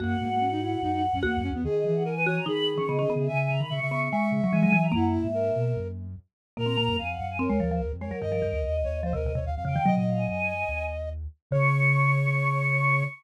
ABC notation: X:1
M:4/4
L:1/16
Q:1/4=146
K:B
V:1 name="Choir Aahs"
f16 | d d e f g3 a b2 z c' d3 e | g g a b c'3 c' c'2 z c' g3 a | f e7 z8 |
[K:Db] b4 a g2 a d3 c z2 B2 | B4 e4 e4 z2 =g2 | e2 f a a6 z6 | d'16 |]
V:2 name="Flute"
A,2 A, A, C D E2 D D z C A,2 C B, | G4 A B c2 G8 | e4 e e e2 e8 | E4 A6 z6 |
[K:Db] B4 f4 B6 d2 | e6 d2 c B2 d f f f2 | e e13 z2 | d16 |]
V:3 name="Marimba"
F12 F4 | z6 F2 D3 C B, C B,2 | z6 B,2 G,3 F, E, F, E,2 | A,12 z4 |
[K:Db] B, C B,2 z4 C A, F, F, z2 A, G, | E, F, E,2 z4 F, C, C, C, z2 D, E, | G,8 z8 | D,16 |]
V:4 name="Ocarina" clef=bass
F,,2 G,,6 F,,3 F,, (3E,,2 F,,2 E,,2 | D,2 E,6 D,3 D, (3C,2 D,2 C,2 | C,2 C, D, C, C,3 z2 C, z G,2 F,2 | F,,3 G,,3 B,,2 F,,4 z4 |
[K:Db] B,,2 B,, G,, F,,2 G,,3 E,, E,,2 E,, F,,2 z | =G,,2 G,, E,, E,,2 E,,3 E,, E,,2 E,, F,,2 z | C, B,, B,,2 G,,4 E,,6 z2 | D,16 |]